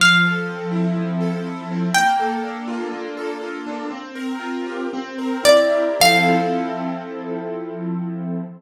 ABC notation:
X:1
M:4/4
L:1/8
Q:1/4=123
K:F
V:1 name="Acoustic Guitar (steel)"
f8 | g8 | "^rit." z6 d2 | f8 |]
V:2 name="Acoustic Grand Piano"
F, A C E F, A E C | B, A D F B, A F D | "^rit." C B F G C B E G | [F,CEA]8 |]